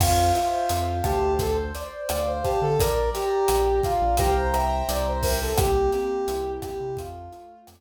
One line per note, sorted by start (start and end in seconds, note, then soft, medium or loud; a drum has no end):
0.00 0.32 F2 loud
0.00 0.33 F4 medium
0.00 1.33 C5 loud
0.00 kick medium
0.00 cross-stick medium
0.00 crash medium
0.34 0.92 F4 medium
0.34 1.33 E5 medium
0.34 closed hi-hat medium
0.69 1.01 F2 medium
0.69 1.37 F5 medium
0.69 closed hi-hat medium
1.04 1.71 D2 medium
1.04 1.33 G4 medium
1.04 1.38 A5 medium
1.04 kick medium
1.04 cross-stick medium
1.04 closed hi-hat medium
1.39 1.57 A4 medium
1.39 2.73 C5 loud
1.39 kick medium
1.39 closed hi-hat medium
1.75 2.74 D5 medium
1.75 closed hi-hat medium
2.09 2.41 D2 medium
2.09 2.26 D5 medium
2.09 2.76 F5 medium
2.09 cross-stick medium
2.09 closed hi-hat medium
2.27 2.44 C5 medium
2.43 2.60 G4 medium
2.43 2.78 A5 medium
2.43 kick medium
2.43 closed hi-hat medium
2.62 2.77 D3 medium
2.62 2.79 A4 medium
2.79 3.11 A#1 medium
2.79 3.09 A#4 medium
2.79 3.47 D5 loud
2.79 kick medium
2.79 closed hi-hat medium
3.13 3.80 G4 medium
3.13 4.13 A#5 medium
3.13 closed hi-hat medium
3.47 3.80 A#1 medium
3.47 4.14 D5 medium
3.47 cross-stick medium
3.47 closed hi-hat medium
3.83 4.16 F4 medium
3.83 4.17 F5 medium
3.83 kick medium
3.83 closed hi-hat medium
4.01 4.17 A#1 medium
4.17 4.82 C2 loud
4.17 4.34 G4 medium
4.17 4.53 C5 loud
4.17 4.53 F5 loud
4.17 4.53 G5 loud
4.17 4.53 A#5 loud
4.17 kick medium
4.17 closed hi-hat medium
4.54 5.51 C5 loud
4.54 5.51 E5 loud
4.54 5.51 G5 loud
4.54 5.51 A#5 loud
4.54 cross-stick medium
4.54 closed hi-hat medium
4.89 5.53 C2 medium
4.89 5.05 D5 medium
4.89 closed hi-hat medium
5.07 5.24 C5 medium
5.23 5.39 A#4 medium
5.23 kick medium
5.23 open hi-hat medium
5.42 5.58 A4 medium
5.57 5.90 C2 medium
5.57 6.90 A#3 medium
5.57 5.90 G4 medium
5.57 kick medium
5.57 cross-stick loud
5.57 closed hi-hat medium
5.92 6.94 C4 medium
5.92 6.52 G4 medium
5.92 closed hi-hat medium
6.28 6.59 C2 medium
6.28 6.96 E4 medium
6.28 closed hi-hat medium
6.62 6.96 G4 medium
6.62 6.97 G4 medium
6.62 kick medium
6.62 cross-stick medium
6.62 closed hi-hat medium
6.80 6.96 C3 medium
6.97 7.29 F2 medium
6.97 7.68 A3 loud
6.97 7.60 F4 medium
6.97 kick medium
6.97 closed hi-hat medium
7.32 7.81 F4 medium
7.32 closed hi-hat medium
7.67 7.81 F2 medium
7.67 7.81 A3 medium
7.67 cross-stick medium
7.67 closed hi-hat medium